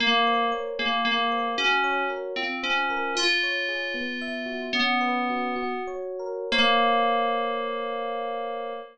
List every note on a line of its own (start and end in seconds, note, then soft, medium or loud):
0.00 0.45 A#3 medium
0.00 0.73 A#4 medium
0.27 0.77 C5 medium
0.52 0.77 C#5 medium
0.79 1.01 A#3 medium
0.79 1.54 G#4 medium
1.05 1.48 A#3 medium
1.05 1.56 A#4 medium
1.32 1.57 C5 medium
1.58 2.03 C#4 medium
1.58 2.33 F#4 loud
1.84 2.34 C#5 medium
2.10 2.35 A#4 medium
2.36 2.58 C4 medium
2.36 3.12 F4 loud
2.63 3.14 C#4 medium
2.63 3.13 C5 medium
2.90 3.15 A#4 medium
3.15 3.90 F4 medium
3.15 4.61 F4 medium
3.43 3.93 C#5 medium
3.69 3.94 G#4 medium
3.94 4.69 B3 medium
4.21 4.71 E5 medium
4.46 4.71 F#4 medium
4.73 5.73 B3 medium
4.73 5.53 C#4 medium
5.01 5.55 B4 medium
5.30 5.55 F#4 medium
5.56 6.45 F#4 loud
5.87 6.48 C#5 medium
6.19 6.50 A#4 medium
6.52 8.73 A#3 loud
6.52 8.73 A#4 loud
6.52 8.73 C5 loud
6.52 8.73 C#5 medium
6.52 8.73 F5 loud